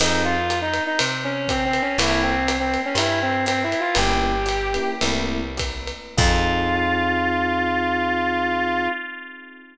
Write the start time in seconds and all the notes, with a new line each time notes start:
0.00 F2 C4 D#4 F4 G#4, crash, ride
0.25 F4
0.50 hi-hat pedal, ride
0.62 D#4
0.74 ride
0.87 D#4
0.99 C3, ride
1.24 C#4
1.48 C4, kick, hi-hat pedal, ride
1.65 C4
1.73 ride
1.82 C#4
1.98 C2 A#3 C4 E4 A4, ride
2.23 C4
2.48 hi-hat pedal, ride
2.60 C4
2.74 ride
2.86 C#4
2.95 G2 E4, ride
3.22 C4
3.46 C4, hi-hat pedal, ride
3.64 E4
3.72 ride
3.80 F4
3.95 G1 A#3 C#4 E4 G4, ride
4.46 hi-hat pedal, ride
4.74 A#3 C#4 E4 G4, ride
5.01 C2 A3 A#3 C4 E4, ride
5.57 kick, hi-hat pedal, ride
5.87 ride
6.17 F2 C4 D#4 F4 G#4, kick, crash